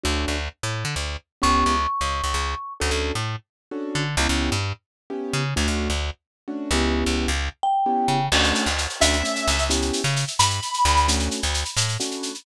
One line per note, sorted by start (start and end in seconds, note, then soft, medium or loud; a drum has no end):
0.03 0.25 D2 medium
0.03 0.36 A3 medium
0.03 0.36 C#4 medium
0.03 0.36 D4 medium
0.03 0.36 F#4 medium
0.28 0.49 D2 medium
0.63 0.84 A2 medium
0.85 0.95 D3 medium
0.96 1.17 D2 medium
1.42 1.64 C#2 medium
1.42 1.74 B3 medium
1.42 1.74 C#4 medium
1.42 1.74 E4 medium
1.42 1.74 G4 medium
1.42 2.73 C#6 medium
1.66 1.87 C#2 medium
2.01 2.22 C#2 medium
2.24 2.34 C#2 medium
2.34 2.55 C#2 medium
2.80 2.91 D2 medium
2.80 3.12 C#4 medium
2.80 3.12 D4 medium
2.80 3.12 F#4 medium
2.80 3.12 A4 medium
2.91 3.12 D2 medium
3.15 3.36 A2 medium
3.71 4.03 C#4 medium
3.71 4.03 D4 medium
3.71 4.03 F#4 medium
3.71 4.03 A4 medium
3.95 4.16 D3 medium
4.17 4.27 C#2 medium
4.17 4.52 B3 medium
4.17 4.52 C#4 medium
4.17 4.52 E4 medium
4.17 4.52 G4 medium
4.29 4.50 C#2 medium
4.52 4.73 G2 medium
5.10 5.42 B3 medium
5.10 5.42 C#4 medium
5.10 5.42 E4 medium
5.10 5.42 G4 medium
5.33 5.54 C#3 medium
5.56 5.67 D2 medium
5.56 5.88 A3 medium
5.56 5.88 C#4 medium
5.56 5.88 D4 medium
5.56 5.88 F#4 medium
5.68 5.88 D2 medium
5.90 6.10 D2 medium
6.48 6.69 A3 medium
6.48 6.69 C#4 medium
6.48 6.69 D4 medium
6.48 6.69 F#4 medium
6.71 7.04 C#2 medium
6.71 7.28 B3 medium
6.71 7.28 C#4 medium
6.71 7.28 E4 medium
6.71 7.28 G4 medium
7.06 7.27 C#2 medium
7.28 7.49 C#2 medium
7.63 8.26 G5 medium
7.86 8.18 B3 medium
7.86 8.18 C#4 medium
7.86 8.18 E4 medium
7.86 8.18 G4 medium
8.08 8.29 C#3 medium
8.32 8.52 D2 medium
8.32 8.65 A3 medium
8.32 8.65 C#4 medium
8.32 8.65 D4 medium
8.32 8.65 F#4 medium
8.32 crash loud
8.43 shaker medium
8.55 shaker medium
8.66 8.87 D2 medium
8.66 shaker medium
8.78 shaker medium
8.89 shaker medium
9.00 9.23 D2 medium
9.00 9.17 A3 medium
9.00 9.17 C#4 medium
9.00 9.17 D4 medium
9.00 9.17 F#4 medium
9.00 9.64 E5 medium
9.00 shaker loud
9.13 shaker medium
9.23 9.55 A3 medium
9.23 9.55 C#4 medium
9.23 9.55 D4 medium
9.23 9.55 F#4 medium
9.23 shaker medium
9.36 shaker medium
9.47 9.91 C#2 medium
9.47 shaker medium
9.58 shaker medium
9.70 10.02 B3 medium
9.70 10.02 C#4 medium
9.70 10.02 E4 medium
9.70 10.02 G4 medium
9.70 shaker loud
9.82 shaker medium
9.93 shaker medium
10.04 10.25 C#3 medium
10.04 shaker medium
10.16 shaker medium
10.27 shaker medium
10.39 10.60 G2 medium
10.39 11.02 B5 medium
10.39 shaker loud
10.50 shaker medium
10.62 shaker medium
10.74 shaker medium
10.85 11.29 D2 medium
10.85 shaker medium
10.96 shaker medium
11.08 11.40 A3 medium
11.08 11.40 C#4 medium
11.08 11.40 D4 medium
11.08 11.40 F#4 medium
11.08 shaker loud
11.19 shaker medium
11.31 shaker medium
11.42 11.64 D2 medium
11.42 shaker medium
11.54 shaker medium
11.65 shaker medium
11.77 11.97 A2 medium
11.77 shaker loud
11.88 shaker medium
12.00 12.32 A3 medium
12.00 12.32 C#4 medium
12.00 12.32 D4 medium
12.00 12.32 F#4 medium
12.00 shaker medium
12.11 shaker medium
12.23 shaker medium
12.35 shaker medium